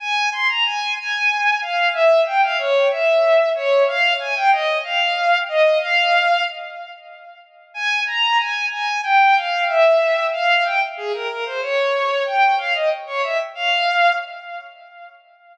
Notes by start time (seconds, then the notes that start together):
0.00 G#5
0.32 C6
0.48 A#5
0.65 G#5
0.97 G#5
1.61 F5
1.93 E5
2.26 G5
2.42 F5
2.58 C#5
2.90 E5
3.55 C#5
3.87 F5
4.19 G#5
4.35 G5
4.51 D#5
4.84 F5
5.48 D#5
5.81 F5
7.74 G#5
8.06 A#5
8.39 G#5
8.71 G#5
9.03 G5
9.35 F5
9.68 E5
10.32 F5
10.65 G5
10.97 G#4
11.13 A#4
11.29 A#4
11.45 C5
11.61 C#5
12.26 G5
12.58 F5
12.74 D#5
13.06 C#5
13.23 E5
13.55 F5